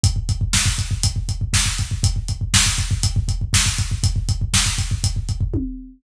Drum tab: HH |x-x---x-x-x---x-|x-x---x-x-x---x-|x-x---x-x-x-----|
SD |----o-------o---|----o-------o---|----o-----------|
T1 |----------------|----------------|------------o---|
BD |oooooooooooooooo|oooooooooooooooo|ooooooooooooo---|